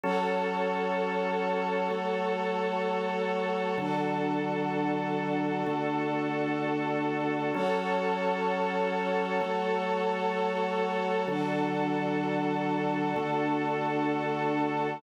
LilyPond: <<
  \new Staff \with { instrumentName = "Drawbar Organ" } { \time 6/8 \key fis \minor \tempo 4. = 64 <fis cis' a'>2. | <fis a a'>2. | <d fis a'>2. | <d a a'>2. |
<fis cis' a'>2. | <fis a a'>2. | <d fis a'>2. | <d a a'>2. | }
  \new Staff \with { instrumentName = "String Ensemble 1" } { \time 6/8 \key fis \minor <fis' a' cis''>2.~ | <fis' a' cis''>2. | <d' fis' a'>2.~ | <d' fis' a'>2. |
<fis' a' cis''>2.~ | <fis' a' cis''>2. | <d' fis' a'>2.~ | <d' fis' a'>2. | }
>>